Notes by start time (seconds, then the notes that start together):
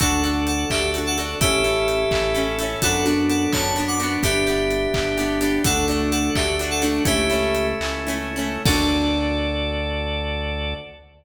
0.00 D2 D4 F#4 A4 F#5, kick, closed hi-hat
0.24 D4 F#4 A4, closed hi-hat
0.47 A4 F#5, closed hi-hat
0.70 D2 D4 F#4 G4 A4 E5, kick, clap
0.94 D4 F#4 A4, closed hi-hat
1.07 A4 F#5
1.18 D4 F#4 A4, closed hi-hat
1.41 A1 C#4 E4 G4 A4 E5, kick, closed hi-hat
1.64 C#4 E4 A4, closed hi-hat
1.88 closed hi-hat
2.11 A1 C#4 E4 A4, kick, clap
2.35 C#4 E4 A4, closed hi-hat
2.59 E4 A4, closed hi-hat
2.63 C#4
2.82 F#2 B3 D4 F#4 A4 F#5, kick, closed hi-hat
3.05 B3 D4 F#4, closed hi-hat
3.29 A4 F#5, closed hi-hat
3.53 F#2 B3 D4 F#4 C#5 A5, kick, clap
3.76 B3 D4 F#4, closed hi-hat
3.88 F#5 D6
4.00 B3 D4 F#4, closed hi-hat
4.23 G1 B3 D4 G4 E5, kick, closed hi-hat
4.47 B3 D4 G4, closed hi-hat
4.71 closed hi-hat
4.94 G1 B3 D4 G4, kick, clap
5.17 B3 D4 G4, closed hi-hat
5.41 B3 D4 G4, closed hi-hat
5.64 D2 A3 D4 F#4 A4 F#5, kick, closed hi-hat
5.88 A3 D4 F#4, closed hi-hat
6.11 A4 F#5, closed hi-hat
6.35 D2 A3 D4 F#4 G4 E5, kick, clap
6.59 A3 D4 F#4, closed hi-hat
6.71 A4 F#5
6.82 A3 D4 F#4, closed hi-hat
7.05 C#2 A3 C#4 E4 G4 E5, kick, closed hi-hat
7.30 A3 C#4 E4, closed hi-hat
7.55 closed hi-hat
7.81 C#2 A3 C#4 E4, clap
8.07 A3 C#4 E4, closed hi-hat
8.36 A3 C#4 E4
8.65 D2 D4 F#4 A4 D5, kick, crash